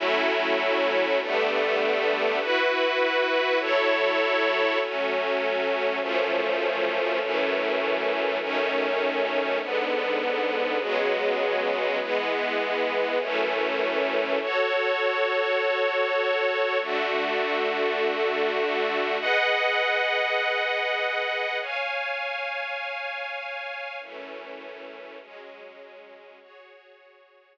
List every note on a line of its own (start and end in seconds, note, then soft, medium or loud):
0.00 1.19 F#3 medium
0.00 1.19 A3 medium
0.00 1.19 C#4 medium
0.00 1.19 E4 medium
1.21 2.39 D3 medium
1.21 2.39 G3 medium
1.21 2.39 A3 medium
1.21 2.39 B3 medium
2.40 3.59 E4 medium
2.40 3.59 F#4 medium
2.40 3.59 B4 medium
3.60 4.78 F#3 medium
3.60 4.78 E4 medium
3.60 4.78 A4 medium
3.60 4.78 C#5 medium
4.80 5.99 F#3 medium
4.80 5.99 A3 medium
4.80 5.99 C#4 medium
6.00 7.19 F#2 medium
6.00 7.19 F3 medium
6.00 7.19 A3 medium
6.00 7.19 C#4 medium
7.20 8.39 F#2 medium
7.20 8.39 E3 medium
7.20 8.39 A3 medium
7.20 8.39 C#4 medium
8.40 9.59 F#2 medium
8.40 9.59 D#3 medium
8.40 9.59 A3 medium
8.40 9.59 C#4 medium
9.61 10.79 G#2 medium
9.61 10.79 D3 medium
9.61 10.79 B3 medium
10.80 11.99 C#3 medium
10.80 11.99 F#3 medium
10.80 11.99 G#3 medium
10.80 11.99 B3 medium
12.00 13.19 E3 medium
12.00 13.19 G#3 medium
12.00 13.19 B3 medium
13.20 14.39 F#2 medium
13.20 14.39 E3 medium
13.20 14.39 A3 medium
13.20 14.39 C#4 medium
14.40 16.78 F#4 medium
14.40 16.78 A4 medium
14.40 16.78 C#5 medium
16.80 19.17 D3 medium
16.80 19.17 A3 medium
16.80 19.17 F#4 medium
19.21 21.58 G#4 medium
19.21 21.58 B4 medium
19.21 21.58 D#5 medium
19.21 21.58 F#5 medium
21.61 23.98 C#5 medium
21.61 23.98 F5 medium
21.61 23.98 G#5 medium
24.00 25.19 F#2 medium
24.00 25.19 E3 medium
24.00 25.19 A3 medium
24.00 25.19 C#4 medium
25.20 26.39 F#3 medium
25.20 26.39 G#3 medium
25.20 26.39 C#4 medium
26.41 27.57 F#4 medium
26.41 27.57 G#4 medium
26.41 27.57 C#5 medium